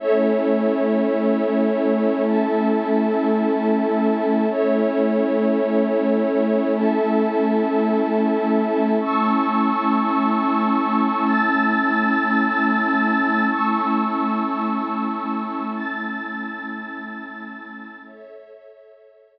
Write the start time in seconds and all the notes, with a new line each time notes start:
0.00 A3 C#4 E4 A4 C#5 E5
2.25 A4 E5 A5
4.49 A3 C#4 E4 A4 C#5 E5
6.75 A4 E5 A5
9.00 A3 C#4 E4 A5 C#6 E6
11.25 A5 E6 A6
13.50 A3 C#4 E4 A5 C#6 E6
15.75 A5 E6 A6
18.00 A4 C#5 E5